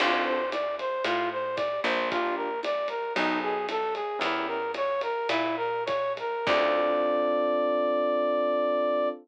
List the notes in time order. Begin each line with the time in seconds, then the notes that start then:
0.00 D2 C4 D4 F4 A4, crash, ride
0.25 C5
0.51 D5, hi-hat pedal, ride
0.79 C5, ride
1.04 A2 F4, ride
1.32 C5
1.56 D5, kick, hi-hat pedal, ride
1.84 A#1 C5, ride
2.11 D4 F4 G4 A#4, kick, ride
2.36 A#4
2.63 D5, hi-hat pedal, ride
2.88 A#4, ride
3.15 B1 D#4 G#4 A4 B4, ride
3.42 G#4
3.69 A4, hi-hat pedal, ride
3.95 G#4, ride
4.19 E2 C#4 E4 G4 A#4, ride
4.47 A#4
4.74 C#5, hi-hat pedal, ride
5.01 A#4, ride
5.29 A#2 E4, ride
5.57 A#4
5.86 C#5, kick, hi-hat pedal, ride
6.17 A#4, ride
6.46 D2 C4 D4 F4 A4 D5, kick, crash